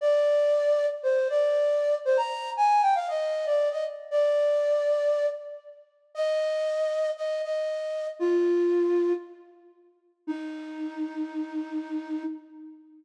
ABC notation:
X:1
M:4/4
L:1/16
Q:1/4=117
K:Eb
V:1 name="Flute"
d8 c2 d6 | c b3 a2 g f e3 d2 e z2 | d10 z6 | e8 e2 e6 |
F8 z8 | E16 |]